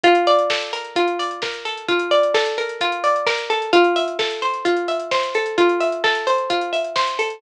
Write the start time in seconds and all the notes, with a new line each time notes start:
0.03 F4, kick, closed hi-hat
0.15 closed hi-hat
0.27 D5, open hi-hat
0.39 closed hi-hat
0.50 A4, kick, snare
0.61 closed hi-hat
0.73 A#4, open hi-hat
0.84 closed hi-hat
0.96 F4, kick, closed hi-hat
1.07 closed hi-hat
1.19 D5, open hi-hat
1.31 closed hi-hat
1.42 A#4, kick, snare
1.54 closed hi-hat
1.65 A4, open hi-hat
1.77 closed hi-hat
1.88 F4, kick, closed hi-hat
1.99 closed hi-hat
2.11 D5, open hi-hat
2.23 closed hi-hat
2.34 A4, kick, snare
2.46 closed hi-hat
2.58 A#4, open hi-hat
2.69 closed hi-hat
2.81 F4, kick, closed hi-hat
2.92 closed hi-hat
3.04 D5, open hi-hat
3.16 closed hi-hat
3.26 A#4, kick, snare
3.38 closed hi-hat
3.50 A4, open hi-hat
3.62 closed hi-hat
3.73 F4, kick, closed hi-hat
3.84 closed hi-hat
3.96 E5, open hi-hat
4.08 closed hi-hat
4.19 A4, kick, snare
4.30 closed hi-hat
4.42 C5, open hi-hat
4.54 closed hi-hat
4.65 F4, kick, closed hi-hat
4.77 closed hi-hat
4.88 E5, open hi-hat
5.00 closed hi-hat
5.11 C5, kick, snare
5.23 closed hi-hat
5.34 A4, open hi-hat
5.46 closed hi-hat
5.58 F4, kick, closed hi-hat
5.69 closed hi-hat
5.80 E5, open hi-hat
5.92 closed hi-hat
6.04 A4, kick, snare
6.15 closed hi-hat
6.27 C5, open hi-hat
6.38 closed hi-hat
6.50 F4, kick, closed hi-hat
6.61 closed hi-hat
6.73 E5, open hi-hat
6.84 closed hi-hat
6.96 C5, kick, snare
7.07 closed hi-hat
7.19 A4, open hi-hat
7.30 closed hi-hat